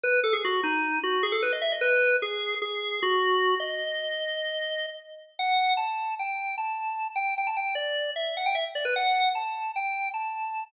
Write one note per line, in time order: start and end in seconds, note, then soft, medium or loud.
0.04 0.20 B4 loud
0.24 0.33 A4 medium
0.33 0.42 G#4 medium
0.45 0.61 F#4 medium
0.64 0.99 D#4 medium
1.03 1.23 F#4 medium
1.23 1.32 G#4 medium
1.32 1.41 A4 medium
1.42 1.52 B4 medium
1.53 1.62 D#5 medium
1.62 1.71 E5 medium
1.72 1.82 D#5 medium
1.81 2.16 B4 loud
2.22 2.55 G#4 medium
2.62 3.00 G#4 medium
3.03 3.55 F#4 medium
3.60 4.86 D#5 medium
5.39 5.73 F#5 medium
5.77 6.14 A5 medium
6.19 6.55 G5 medium
6.58 7.07 A5 medium
7.16 7.34 G5 medium
7.38 7.47 G5 medium
7.47 7.56 A5 medium
7.57 7.75 G5 medium
7.75 8.11 D5 medium
8.16 8.34 E5 medium
8.37 8.46 F#5 medium
8.46 8.55 G5 loud
8.55 8.64 E5 medium
8.75 8.85 D5 medium
8.85 8.94 B4 medium
8.96 9.29 F#5 medium
9.35 9.71 A5 medium
9.76 10.09 G5 medium
10.14 10.64 A5 medium